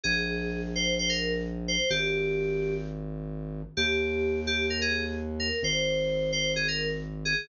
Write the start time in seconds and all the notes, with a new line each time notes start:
0.03 A#1 G#4
0.75 C5
0.99 C5
1.09 A#4
1.68 C5
1.90 G#1 G4
3.77 D#2 G4
4.47 G4
4.70 A#4
4.81 G#4
5.39 A#4
5.63 G#1 C5
6.32 C5
6.56 G#4
6.68 A#4
7.25 G#4